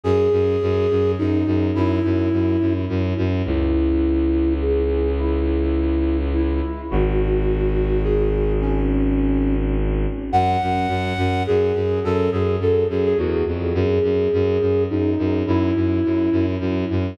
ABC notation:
X:1
M:3/4
L:1/16
Q:1/4=105
K:F#m
V:1 name="Flute"
G8 ^D4 | E8 z4 | [K:C#m] E8 G4 | E8 E4 |
F8 G4 | C8 z4 | [K:F#m] f8 G4 | A2 G2 A2 G G F2 z2 |
G8 ^D4 | E8 z4 |]
V:2 name="Violin" clef=bass
F,,2 F,,2 F,,2 F,,2 F,,2 F,,2 | F,,2 F,,2 F,,2 F,,2 F,,2 F,,2 | [K:C#m] C,,12- | C,,12 |
G,,,12- | G,,,12 | [K:F#m] F,,2 F,,2 F,,2 F,,2 F,,2 F,,2 | F,,2 F,,2 F,,2 F,,2 E,,2 ^E,,2 |
F,,2 F,,2 F,,2 F,,2 F,,2 F,,2 | F,,2 F,,2 F,,2 F,,2 F,,2 F,,2 |]